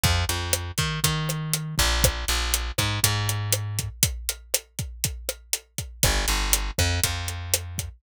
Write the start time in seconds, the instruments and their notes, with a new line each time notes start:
0.03 electric bass (finger) F2, kick, closed hi-hat
0.29 electric bass (finger) F2, closed hi-hat
0.53 cross-stick, closed hi-hat
0.78 electric bass (finger) D#3, kick, closed hi-hat
1.04 electric bass (finger) D#3, kick, closed hi-hat
1.29 cross-stick, closed hi-hat
1.53 closed hi-hat
1.78 electric bass (finger) A#1, kick, closed hi-hat
2.04 kick, cross-stick, closed hi-hat
2.28 electric bass (finger) A#1, closed hi-hat
2.54 closed hi-hat
2.78 electric bass (finger) G#2, kick, cross-stick, closed hi-hat
3.03 electric bass (finger) G#2, kick, closed hi-hat
3.29 closed hi-hat
3.52 cross-stick, closed hi-hat
3.79 kick, closed hi-hat
4.03 kick, closed hi-hat
4.29 closed hi-hat
4.54 cross-stick, closed hi-hat
4.79 kick, closed hi-hat
5.04 kick, closed hi-hat
5.29 cross-stick, closed hi-hat
5.53 closed hi-hat
5.78 kick, closed hi-hat
6.03 electric bass (finger) G1, kick, cross-stick, closed hi-hat
6.28 electric bass (finger) G1, closed hi-hat
6.53 closed hi-hat
6.78 electric bass (finger) F2, kick, cross-stick, closed hi-hat
7.04 electric bass (finger) F2, kick, closed hi-hat
7.28 closed hi-hat
7.54 cross-stick, closed hi-hat
7.78 kick, closed hi-hat